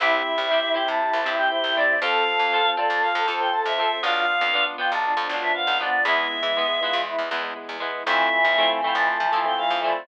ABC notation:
X:1
M:4/4
L:1/16
Q:1/4=119
K:Am
V:1 name="Choir Aahs"
e6 g a4 g g2 d2 | f6 d2 f3 g a e3 | f6 g a4 e f2 d2 | e8 z8 |
e6 g a4 g f2 d2 |]
V:2 name="Choir Aahs"
E16 | A16 | F2 z4 F2 D4 B,2 B,2 | E2 z4 F2 E2 z6 |
E,16 |]
V:3 name="Electric Piano 1"
[CEG]3 [CEG]2 [CEG] [CEG]5 [CEG] [CEG]2 [CEG]2 | [CFA]3 [CFA]2 [CFA] [CFA]5 [CFA] [CFA]2 [CFA]2 | [B,DF]3 [B,DF]2 [B,DF] [B,DF]5 [B,DF] [B,DF]2 [B,DF]2 | [^G,B,E]3 [G,B,E]2 [G,B,E] [G,B,E]5 [G,B,E] [G,B,E]2 [G,B,E]2 |
[A,CEF]3 [A,CEF]2 [A,CEF] [A,CEF]5 [A,CEF] [A,CEF]2 [A,CEF]2 |]
V:4 name="Acoustic Guitar (steel)"
[CEG]4 [CEG]2 [CEG]4 [CEG]4 [CEG]2 | [CFA]4 [CFA]2 [CFA]4 [CFA]4 [CFA]2 | [B,DF]4 [B,DF]2 [B,DF]4 [B,DF]4 [B,DF]2 | [^G,B,E]4 [G,B,E]2 [G,B,E]4 [G,B,E]4 [G,B,E]2 |
[A,CEF]4 [A,CEF]2 [A,CEF]4 [A,CEF]4 [A,CEF]2 |]
V:5 name="Electric Bass (finger)" clef=bass
C,,3 C,,4 C,2 C,, G,,3 C,,3 | F,,3 F,,4 F,,2 F,, F,,3 F,,3 | B,,,3 F,,4 B,,,2 F,, B,,,3 B,,,3 | E,,3 E,4 E,,2 E,, E,,3 E,,3 |
F,,3 F,,4 F,,2 F, F,3 F,,3 |]
V:6 name="String Ensemble 1"
[CEG]8 [CGc]8 | [CFA]8 [CAc]8 | [B,DF]8 [F,B,F]8 | [^G,B,E]8 [E,G,E]8 |
[A,CEF]8 [A,CFA]8 |]